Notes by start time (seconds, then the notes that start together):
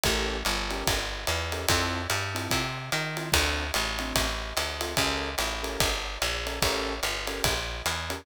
0.04 A1 C#4 G4 A4 A#4, kick, ride
0.45 G1, hi-hat pedal, ride
0.71 C#4 G4 A4 A#4, ride
0.87 G1, kick, ride
1.27 E2, hi-hat pedal, ride
1.52 C#4 G4 A4 A#4, ride
1.68 F2 C4 E4 F4 A4, kick, ride
2.10 G2, hi-hat pedal, ride
2.35 C4 E4 F4 A4, ride
2.51 C3, kick, ride
2.92 D#3, hi-hat pedal, ride
3.17 C4 E4 F4 A4, ride
3.32 D2 C4 D4 F4 A4, kick, ride
3.74 A1, hi-hat pedal, ride
3.99 C4 D4 F4 A4, ride
4.16 A1, kick, ride
4.57 D2, hi-hat pedal, ride
4.81 C4 D4 F4 A4, ride
4.97 C#2 C#4 G4 A4 A#4, kick, ride
5.38 A1, hi-hat pedal, ride
5.63 C#4 G4 A4 A#4, ride
5.80 G1, kick, ride
6.22 A#1, hi-hat pedal, ride
6.46 C#4 G4 A4 A#4, ride
6.62 A1 C#4 G4 A4 A#4, kick, ride
7.03 G1, hi-hat pedal, ride
7.27 C#4 G4 A4 A#4, ride
7.44 A#1, kick, ride
7.86 E2, hi-hat pedal, ride
8.10 C#4 G4 A4 A#4, ride